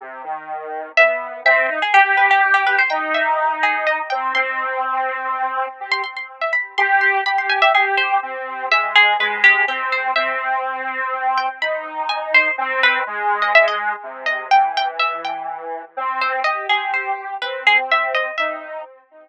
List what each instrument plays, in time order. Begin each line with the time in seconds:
0.01 lead 1 (square) C3
0.24 lead 1 (square) D#3
0.97 lead 1 (square) B3, harpsichord E5
1.45 lead 1 (square) C4, harpsichord E5
1.69 lead 1 (square) D#4
1.82 harpsichord G#4
1.93 lead 1 (square) G4, harpsichord G4
2.17 harpsichord B4
2.31 harpsichord G4
2.54 harpsichord G4
2.67 harpsichord B4
2.79 harpsichord C5
2.90 lead 1 (square) D#4, harpsichord G5
3.14 harpsichord E5
3.63 harpsichord G#4
3.87 harpsichord D#5
4.10 lead 1 (square) C4, harpsichord G5
4.35 lead 1 (square) C4, harpsichord C6
5.80 lead 1 (square) G4
5.92 harpsichord C6
6.04 harpsichord C6
6.17 harpsichord C6
6.41 harpsichord E5
6.53 harpsichord B5
6.78 lead 1 (square) G4, harpsichord C6
7.01 harpsichord C6
7.26 lead 1 (square) G4, harpsichord B5
7.38 harpsichord C6
7.49 harpsichord G#5
7.62 harpsichord E5
7.74 lead 1 (square) G4, harpsichord G#4
7.97 harpsichord C5
8.22 lead 1 (square) C4
8.70 lead 1 (square) G#3, harpsichord E5
8.96 harpsichord G#4
9.19 lead 1 (square) G#3, harpsichord B4
9.44 harpsichord G4
9.68 lead 1 (square) C4, harpsichord G4
9.92 harpsichord C5
10.16 lead 1 (square) C4, harpsichord E5
11.38 harpsichord G5
11.61 lead 1 (square) D#4, harpsichord B5
12.09 harpsichord G#5
12.34 harpsichord C5
12.58 lead 1 (square) C4
12.83 harpsichord B4
13.06 lead 1 (square) G#3
13.42 harpsichord D#5
13.55 harpsichord E5
13.68 harpsichord D#5
14.03 lead 1 (square) C3
14.26 harpsichord D#5
14.51 lead 1 (square) E3, harpsichord G5
14.77 harpsichord G5
14.99 harpsichord E5
15.25 harpsichord G5
15.97 lead 1 (square) C4
16.21 harpsichord C5
16.44 lead 1 (square) G4, harpsichord D#5
16.69 lead 1 (square) G4, harpsichord G#4
16.94 harpsichord C5
17.42 lead 1 (square) C4, harpsichord B4
17.67 harpsichord G#4
17.91 harpsichord E5
18.15 harpsichord D#5
18.38 lead 1 (square) D#4, harpsichord E5